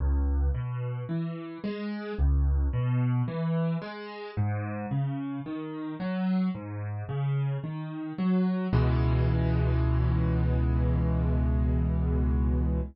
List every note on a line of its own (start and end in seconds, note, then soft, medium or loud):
0.00 0.49 C#2 loud
0.54 1.03 B2 medium
1.09 1.58 E3 medium
1.64 2.13 G#3 medium
2.18 2.67 C#2 loud
2.73 3.22 B2 loud
3.28 3.77 E3 medium
3.82 4.31 G#3 medium
4.37 4.86 G#2 loud
4.91 5.40 C#3 medium
5.46 5.95 D#3 medium
6.00 6.49 F#3 medium
6.55 7.04 G#2 medium
7.09 7.58 C#3 medium
7.64 8.13 D#3 medium
8.18 8.67 F#3 medium
8.73 12.80 C#2 medium
8.73 12.80 B2 loud
8.73 12.80 E3 medium
8.73 12.80 G#3 loud